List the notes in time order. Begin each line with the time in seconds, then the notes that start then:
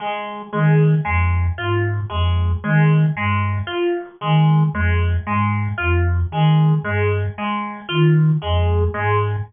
0.00 G#3
0.53 D#3 G#3
1.05 F2 G#3
1.58 G#2 F4
2.10 F2 G#3
2.64 D#3 G#3
3.15 G2 G#3
3.67 F4
4.21 D#3 G#3
4.73 F2 G#3
5.26 G#2 G#3
5.78 F2 F4
6.31 D#3 G#3
6.83 G2 G#3
7.38 G#3
7.89 D#3 F4
8.42 F2 G#3
8.94 G#2 G#3